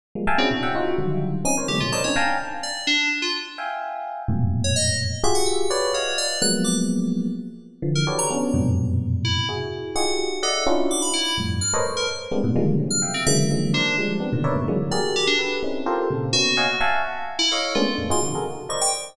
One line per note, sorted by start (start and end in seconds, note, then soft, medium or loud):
0.15 0.26 F3 medium
0.15 0.26 G3 medium
0.15 0.26 G#3 medium
0.15 0.26 A#3 medium
0.27 0.38 E5 loud
0.27 0.38 F5 loud
0.27 0.38 G5 loud
0.27 0.38 G#5 loud
0.27 0.38 A5 loud
0.38 0.49 C4 loud
0.38 0.49 C#4 loud
0.38 0.49 D4 loud
0.38 0.49 E4 loud
0.38 0.49 F#4 loud
0.38 0.49 G#4 loud
0.51 0.61 A#2 medium
0.51 0.61 B2 medium
0.51 0.61 C3 medium
0.63 0.73 E5 medium
0.63 0.73 F#5 medium
0.63 0.73 G5 medium
0.75 0.96 D#4 loud
0.75 0.96 F4 loud
0.75 0.96 F#4 loud
0.98 1.41 D3 medium
0.98 1.41 D#3 medium
0.98 1.41 F3 medium
0.98 1.41 F#3 medium
0.98 1.41 G3 medium
1.45 1.55 C4 medium
1.45 1.55 C#4 medium
1.45 1.55 D#4 medium
1.45 1.56 G#5 medium
1.57 1.68 A#4 medium
1.57 1.68 C5 medium
1.57 1.68 C#5 medium
1.68 1.80 D3 medium
1.68 1.80 E3 medium
1.68 1.80 F#3 medium
1.68 1.80 G#3 medium
1.68 1.80 A3 medium
1.68 1.80 B3 medium
1.68 1.79 G4 medium
1.80 1.92 A2 medium
1.80 1.92 B2 medium
1.80 1.92 C3 medium
1.80 1.91 F4 medium
1.92 2.03 A#4 medium
1.92 2.03 C5 medium
1.92 2.03 C#5 medium
1.92 2.03 D5 medium
1.92 2.03 D#5 medium
1.92 2.03 A5 medium
2.04 2.15 C4 medium
2.04 2.15 C#4 medium
2.04 2.15 D4 medium
2.04 2.15 D#4 medium
2.04 2.15 C#5 medium
2.16 2.37 F5 medium
2.16 2.37 G5 medium
2.16 2.37 G#5 medium
2.16 2.37 A5 medium
2.16 2.37 A#5 medium
2.63 2.85 D5 medium
2.87 3.08 D4 loud
3.22 3.33 F4 medium
3.58 4.22 E5 medium
3.58 4.22 F5 medium
3.58 4.22 G5 medium
3.58 4.22 G#5 medium
4.28 5.13 F2 medium
4.28 5.13 F#2 medium
4.28 5.13 G#2 medium
4.28 5.13 A2 medium
4.28 5.13 A#2 medium
4.28 5.13 B2 medium
4.64 4.75 C#5 medium
4.76 4.97 D#5 medium
5.24 5.66 F4 loud
5.24 5.66 F#4 loud
5.24 5.66 G4 loud
5.24 5.66 G#4 loud
5.24 5.34 E5 medium
5.35 5.45 F#5 medium
5.46 5.57 E6 medium
5.70 5.92 B4 medium
5.70 5.92 C#5 medium
5.70 5.92 D5 medium
5.93 6.16 C#5 medium
5.93 6.36 D#5 soft
5.93 6.36 F5 soft
5.93 6.36 F#5 soft
6.18 6.39 D5 medium
6.42 7.27 F3 medium
6.42 7.27 F#3 medium
6.42 7.27 G#3 medium
6.42 7.27 A#3 medium
6.42 7.27 B3 medium
6.42 6.52 F#6 loud
6.64 6.75 D6 medium
7.82 8.04 D3 medium
7.82 8.04 E3 medium
7.82 8.04 F3 medium
7.95 8.06 A#4 medium
8.07 8.28 F#4 medium
8.07 8.28 G4 medium
8.07 8.28 A4 medium
8.07 8.28 B4 medium
8.07 8.28 C#5 medium
8.07 8.28 D5 medium
8.19 8.29 A#5 loud
8.30 8.52 B3 loud
8.30 8.52 C#4 loud
8.30 8.52 D4 loud
8.54 9.39 F2 loud
8.54 9.39 F#2 loud
8.54 9.39 G#2 loud
8.54 9.39 A#2 loud
8.54 9.39 B2 loud
8.54 9.39 C3 loud
9.25 9.46 E4 medium
9.49 9.91 E4 medium
9.49 9.91 F#4 medium
9.49 9.91 G#4 medium
9.96 10.27 D#4 medium
9.96 10.27 F4 medium
9.96 10.27 F#4 medium
9.96 10.27 G4 medium
9.96 10.27 G#4 medium
9.96 10.38 F#5 medium
10.43 10.64 A4 medium
10.43 10.64 D5 medium
10.43 10.64 D#5 medium
10.43 10.64 E5 medium
10.43 10.64 F#5 medium
10.67 10.88 C#4 loud
10.67 10.88 D4 loud
10.67 10.88 D#4 loud
10.67 10.88 E4 loud
10.67 10.88 F4 loud
10.67 10.88 F#4 loud
10.91 11.01 D6 medium
11.02 11.13 B5 medium
11.13 11.35 E4 medium
11.38 11.59 F2 medium
11.38 11.59 G2 medium
11.38 11.59 A2 medium
11.61 11.72 F6 medium
11.74 11.84 A4 medium
11.74 11.84 A#4 medium
11.74 11.84 B4 medium
11.74 11.84 C5 medium
11.74 11.84 C#5 medium
11.74 11.84 D#5 medium
11.85 12.06 A#4 medium
11.85 12.06 B4 medium
11.85 12.06 C5 medium
11.97 12.07 A#4 medium
12.31 12.42 G3 medium
12.31 12.42 G#3 medium
12.31 12.42 A#3 medium
12.31 12.42 B3 medium
12.31 12.42 C4 medium
12.31 12.42 D4 medium
12.44 12.55 G#2 loud
12.44 12.55 A2 loud
12.44 12.55 B2 loud
12.56 12.77 D3 loud
12.56 12.77 D#3 loud
12.56 12.77 F3 loud
12.56 12.77 G3 loud
12.56 12.77 G#3 loud
12.56 12.77 A#3 loud
12.79 13.01 C3 medium
12.79 13.01 C#3 medium
12.79 13.01 D#3 medium
12.79 13.01 F3 medium
12.79 13.01 F#3 medium
12.91 13.01 F6 medium
13.02 13.23 E5 medium
13.02 13.23 F5 medium
13.02 13.23 G5 medium
13.14 13.25 C4 medium
13.27 13.48 C#3 loud
13.27 13.48 D3 loud
13.27 13.48 E3 loud
13.27 13.48 F#3 loud
13.27 13.48 G#3 loud
13.27 13.48 A#3 loud
13.27 13.37 E5 loud
13.51 13.72 D3 medium
13.51 13.72 D#3 medium
13.51 13.72 F3 medium
13.51 13.72 F#3 medium
13.51 13.72 G#3 medium
13.51 13.72 A#3 medium
13.74 13.95 D4 loud
13.74 13.95 A#4 medium
13.74 13.95 C5 medium
13.74 13.95 D5 medium
13.98 14.19 F3 medium
13.98 14.19 G3 medium
13.98 14.19 G#3 medium
14.20 14.31 B3 medium
14.20 14.31 C4 medium
14.20 14.31 D4 medium
14.33 14.43 A#2 medium
14.33 14.43 B2 medium
14.33 14.43 C3 medium
14.33 14.43 D3 medium
14.33 14.43 D#3 medium
14.44 14.55 A#4 medium
14.44 14.55 B4 medium
14.44 14.55 C#5 medium
14.44 14.55 D5 medium
14.44 14.55 E5 medium
14.56 14.67 G2 medium
14.56 14.67 G#2 medium
14.56 14.67 A2 medium
14.56 14.67 B2 medium
14.56 14.67 C#3 medium
14.56 14.67 D3 medium
14.68 14.79 D3 medium
14.68 14.79 E3 medium
14.68 14.79 F#3 medium
14.68 14.79 G#3 medium
14.68 14.79 A#3 medium
14.91 15.34 F#4 medium
14.91 15.34 G4 medium
14.91 15.34 G#4 medium
14.91 15.34 A#4 medium
14.91 15.13 D5 medium
15.16 15.26 G4 medium
15.27 15.38 D4 loud
15.39 15.60 G4 medium
15.39 15.60 A4 medium
15.39 15.60 B4 medium
15.63 15.84 C4 medium
15.63 15.84 C#4 medium
15.63 15.84 D#4 medium
15.63 15.84 E4 medium
15.86 16.08 F4 medium
15.86 16.08 G4 medium
15.86 16.08 A4 medium
15.86 16.08 A#4 medium
15.86 16.08 C5 medium
16.10 16.32 A#2 medium
16.10 16.32 C3 medium
16.10 16.32 C#3 medium
16.33 16.55 A#3 medium
16.33 16.55 B3 medium
16.33 16.55 C#4 medium
16.33 16.97 F#4 loud
16.57 16.68 C#5 medium
16.57 16.68 D#5 medium
16.57 16.68 F5 medium
16.57 16.68 F#5 medium
16.57 16.68 G#5 medium
16.81 17.02 E5 loud
16.81 17.02 F5 loud
16.81 17.02 F#5 loud
16.81 17.02 G#5 loud
16.81 17.02 A5 loud
17.39 17.50 E4 loud
17.51 17.73 A4 medium
17.51 17.73 C#5 medium
17.51 17.73 D#5 medium
17.51 17.73 F5 medium
17.75 17.86 G#3 loud
17.75 17.86 A3 loud
17.75 17.86 A#3 loud
17.75 17.86 B3 loud
17.75 17.86 C#4 loud
17.75 17.86 D4 loud
17.75 17.96 F4 medium
17.98 18.09 F2 medium
17.98 18.09 G2 medium
17.98 18.09 A2 medium
18.10 18.21 D#4 medium
18.10 18.21 F4 medium
18.10 18.21 F#4 medium
18.10 18.21 G#4 medium
18.10 18.22 C6 medium
18.23 18.33 C3 medium
18.23 18.33 C#3 medium
18.23 18.33 D#3 medium
18.23 18.33 F3 medium
18.35 18.46 F#4 medium
18.35 18.46 G#4 medium
18.35 18.46 A4 medium
18.35 18.46 A#4 medium
18.69 18.91 A#4 medium
18.69 18.91 C5 medium
18.69 18.91 D5 medium
18.69 18.91 D#5 medium
18.69 18.80 C#6 medium
18.81 18.92 G5 loud